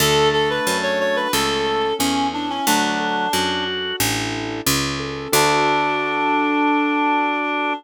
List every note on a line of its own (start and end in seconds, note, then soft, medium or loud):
0.00 0.60 D2 loud
0.00 1.28 A3 medium
0.00 0.67 D4 medium
0.00 0.29 A4 loud
0.33 0.49 A4 medium
0.33 1.29 A4 medium
0.50 0.77 B4 medium
0.67 1.27 F#2 medium
0.67 1.31 D4 medium
0.83 0.99 C#5 medium
0.99 1.31 F#4 medium
0.99 1.16 C#5 medium
1.16 1.32 B4 medium
1.33 1.93 C#2 medium
1.33 1.89 A3 medium
1.33 1.99 C#4 medium
1.33 1.94 A4 medium
1.67 2.62 A4 medium
1.99 2.60 E2 medium
1.99 2.27 C#4 medium
1.99 2.63 C#4 medium
2.33 2.49 D4 medium
2.33 2.65 E4 medium
2.50 2.66 C#4 medium
2.67 3.27 D2 loud
2.67 3.29 F#3 loud
2.67 3.64 D4 loud
2.67 3.33 D4 medium
3.00 3.95 A4 medium
3.33 3.93 F#2 medium
3.33 3.96 D4 medium
3.33 3.96 F#4 medium
3.68 3.99 F#4 medium
4.00 4.61 A1 loud
4.00 4.60 D4 medium
4.00 4.60 E4 medium
4.00 4.60 A4 medium
4.66 5.28 C#2 loud
4.66 5.30 C#4 medium
4.99 5.31 A4 medium
5.33 7.73 D2 loud
5.33 7.73 D4 medium
5.33 7.73 D4 loud
5.33 7.74 D4 loud
5.33 7.73 F#4 medium
5.33 7.73 A4 loud